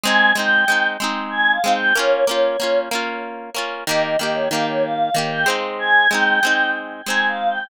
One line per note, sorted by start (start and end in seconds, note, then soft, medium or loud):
0.03 0.33 G#3 medium
0.03 0.33 C4 loud
0.03 0.33 D#4 medium
0.03 0.31 G#5 medium
0.35 0.65 G#3 medium
0.35 0.65 C4 medium
0.35 0.65 D#4 medium
0.35 0.87 G5 medium
0.68 0.97 G#3 medium
0.68 0.97 C4 medium
0.68 0.97 D#4 medium
1.00 1.59 G#3 medium
1.00 1.59 C4 medium
1.00 1.59 D#4 medium
1.31 1.51 G#5 medium
1.52 1.72 F5 medium
1.64 1.93 G#3 medium
1.64 1.93 C4 medium
1.64 1.93 D#4 medium
1.74 1.94 G5 medium
1.95 2.25 A#3 medium
1.95 2.25 C#4 medium
1.95 2.25 F4 medium
1.95 2.24 C#5 medium
2.26 2.57 A#3 medium
2.26 2.57 C#4 medium
2.26 2.78 C#5 medium
2.31 2.57 F4 medium
2.60 2.89 A#3 medium
2.60 2.89 C#4 medium
2.60 2.89 F4 medium
2.91 3.50 A#3 medium
2.91 3.50 C#4 medium
2.91 3.50 F4 medium
3.55 3.84 A#3 medium
3.55 3.84 C#4 medium
3.55 3.84 F4 medium
3.87 4.16 D#3 medium
3.87 4.16 A#3 medium
3.87 4.16 G4 medium
3.87 4.02 D#5 medium
4.03 4.18 D#5 medium
4.19 4.49 D#3 medium
4.19 4.49 A#3 medium
4.19 4.49 G4 medium
4.19 4.34 D#5 medium
4.34 4.49 C#5 medium
4.51 5.10 D#3 medium
4.51 5.10 A#3 medium
4.51 5.10 G4 medium
4.51 4.66 F5 medium
4.68 4.83 C#5 medium
4.84 5.15 F5 medium
5.14 5.45 D#3 medium
5.14 5.45 A#3 medium
5.14 5.45 G4 medium
5.31 5.46 G5 medium
5.46 6.07 G#3 medium
5.46 6.07 C4 medium
5.46 6.07 D#4 medium
5.79 6.07 G#5 medium
6.09 6.40 G#3 medium
6.09 6.40 C4 medium
6.09 6.70 G5 medium
6.14 6.40 D#4 medium
6.43 7.02 G#3 medium
6.43 7.02 C4 medium
6.43 7.02 D#4 medium
7.06 7.65 G#3 medium
7.06 7.65 C4 medium
7.06 7.65 D#4 medium
7.06 7.26 G#5 medium
7.28 7.48 F5 medium
7.49 7.69 G5 medium